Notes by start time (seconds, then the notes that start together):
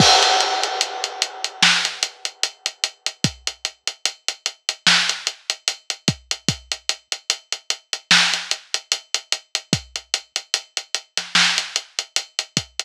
0.00 kick, crash
0.23 closed hi-hat
0.40 closed hi-hat
0.63 closed hi-hat
0.81 closed hi-hat
1.04 closed hi-hat
1.22 closed hi-hat
1.44 closed hi-hat
1.63 snare
1.85 closed hi-hat
2.03 closed hi-hat
2.25 closed hi-hat
2.43 closed hi-hat
2.66 closed hi-hat
2.84 closed hi-hat
3.06 closed hi-hat
3.24 kick, closed hi-hat
3.47 closed hi-hat
3.65 closed hi-hat
3.87 closed hi-hat
4.05 closed hi-hat
4.28 closed hi-hat
4.46 closed hi-hat
4.69 closed hi-hat
4.87 snare
5.09 closed hi-hat
5.27 closed hi-hat
5.50 closed hi-hat
5.68 closed hi-hat
5.90 closed hi-hat
6.08 kick, closed hi-hat
6.31 closed hi-hat
6.48 kick, closed hi-hat
6.72 closed hi-hat
6.89 closed hi-hat
7.12 closed hi-hat
7.30 closed hi-hat
7.52 closed hi-hat
7.70 closed hi-hat
7.93 closed hi-hat
8.11 snare
8.33 snare, closed hi-hat
8.51 closed hi-hat
8.74 closed hi-hat
8.92 closed hi-hat
9.14 closed hi-hat
9.32 closed hi-hat
9.55 closed hi-hat
9.73 kick, closed hi-hat
9.96 closed hi-hat
10.14 closed hi-hat
10.36 closed hi-hat
10.54 closed hi-hat
10.77 closed hi-hat
10.94 closed hi-hat
11.17 snare, closed hi-hat
11.35 snare
11.58 closed hi-hat
11.76 closed hi-hat
11.99 closed hi-hat
12.16 closed hi-hat
12.39 closed hi-hat
12.57 kick, closed hi-hat
12.79 closed hi-hat